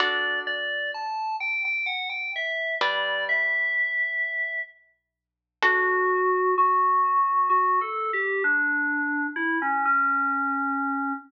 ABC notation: X:1
M:3/4
L:1/16
Q:1/4=64
K:D
V:1 name="Electric Piano 2"
d2 d2 a2 g g f g e2 | d2 e6 z4 | F4 F4 (3F2 A2 G2 | D4 E C C6 |]
V:2 name="Acoustic Guitar (steel)"
[DFA]12 | [G,DB]12 | [DFA]12 | z12 |]